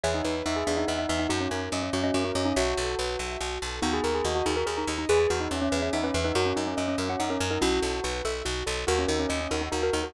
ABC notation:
X:1
M:6/8
L:1/16
Q:3/8=95
K:D#phr
V:1 name="Tubular Bells"
G D D z D G =D ^D D D D D | F C C z C C C C C C C C | F8 z4 | F G A G F F G A G A z2 |
G G F D C C2 C D C z D | F C D C C C2 C D C z D | F6 z6 | F C D C C C D D F F D F |]
V:2 name="Xylophone"
[ce]6 e e e e e e | [DF]6 F d F F F D | [ce]4 z8 | [B,D]6 D A A D D D |
[GB]6 B e e B B B | [FA]6 A f f A A A | [CE]4 F2 =A2 z4 | [FA]6 A D D A A A |]
V:3 name="Acoustic Grand Piano"
G2 B2 e2 G2 B2 e2 | F2 A2 d2 F2 A2 d2 | F2 =A2 B2 e2 F2 A2 | F2 A2 d2 F2 A2 d2 |
G2 B2 e2 G2 B2 e2 | F2 A2 d2 F2 A2 d2 | F2 =A2 B2 e2 F2 A2 | F2 A2 d2 F2 A2 d2 |]
V:4 name="Electric Bass (finger)" clef=bass
E,,2 E,,2 E,,2 E,,2 E,,2 E,,2 | F,,2 F,,2 F,,2 F,,2 F,,2 F,,2 | B,,,2 B,,,2 B,,,2 B,,,2 B,,,2 B,,,2 | D,,2 D,,2 D,,2 D,,2 D,,2 D,,2 |
E,,2 E,,2 E,,2 E,,2 E,,2 E,,2 | F,,2 F,,2 F,,2 F,,2 F,,2 F,,2 | B,,,2 B,,,2 B,,,2 B,,,2 B,,,2 B,,,2 | D,,2 D,,2 D,,2 D,,2 D,,2 D,,2 |]